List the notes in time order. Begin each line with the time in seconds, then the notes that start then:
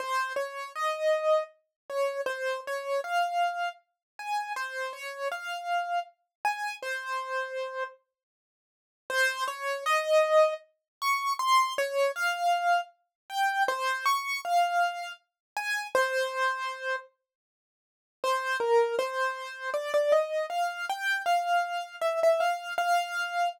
0.00 C5
0.36 C#5
0.75 D#5
1.90 C#5
2.26 C5
2.67 C#5
3.04 F5
4.19 G#5
4.56 C5
4.93 C#5
5.32 F5
6.45 G#5
6.82 C5
9.10 C5
9.48 C#5
9.86 D#5
11.02 C#6
11.39 C6
11.78 C#5
12.16 F5
13.30 G5
13.68 C5
14.06 C#6
14.45 F5
15.57 G#5
15.95 C5
18.24 C5
18.60 A#4
18.99 C5
19.74 D5
19.94 D5
20.12 D#5
20.50 F5
20.90 G5
21.26 F5
22.01 E5
22.23 E5
22.40 F5
22.78 F5